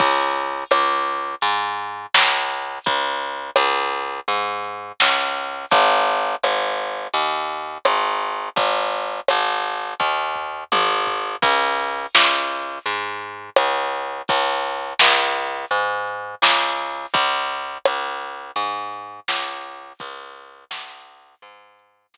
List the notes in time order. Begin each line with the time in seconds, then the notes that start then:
0.00 C#2, kick, crash
0.36 closed hi-hat
0.71 C#2, cross-stick
1.08 closed hi-hat
1.41 G#2, closed hi-hat
1.79 closed hi-hat
2.14 C#2, snare
2.50 closed hi-hat
2.84 C#2, kick, closed hi-hat
3.23 closed hi-hat
3.56 C#2, cross-stick
3.93 closed hi-hat
4.28 G#2, closed hi-hat
4.64 closed hi-hat
5.00 C#2, snare
5.36 closed hi-hat
5.71 G#1, kick, closed hi-hat
6.07 closed hi-hat
6.43 G#1, cross-stick
6.78 closed hi-hat
7.14 D#2, closed hi-hat
7.51 closed hi-hat
7.85 G#1, cross-stick
8.20 closed hi-hat
8.56 G#1, kick, closed hi-hat
8.91 closed hi-hat
9.28 G#1, cross-stick
9.63 closed hi-hat
10.00 D#2, kick
10.36 floor tom
10.72 G#1, high tom
11.07 floor tom
11.42 C#2, kick, crash
11.79 closed hi-hat
12.15 C#2, snare
12.50 closed hi-hat
12.86 G#2, closed hi-hat
13.21 closed hi-hat
13.56 C#2, cross-stick
13.94 closed hi-hat
14.28 C#2, kick, closed hi-hat
14.64 closed hi-hat
14.99 C#2, snare
15.35 closed hi-hat
15.71 G#2, closed hi-hat
16.07 closed hi-hat
16.42 C#2, snare
16.79 closed hi-hat
17.14 C#2, kick, closed hi-hat
17.51 closed hi-hat
17.85 C#2, cross-stick
18.21 closed hi-hat
18.56 G#2, closed hi-hat
18.93 closed hi-hat
19.28 C#2, snare
19.64 closed hi-hat
19.99 C#2, kick, closed hi-hat
20.36 closed hi-hat
20.71 C#2, snare
21.07 closed hi-hat
21.42 G#2, closed hi-hat
21.79 closed hi-hat
22.14 C#2, snare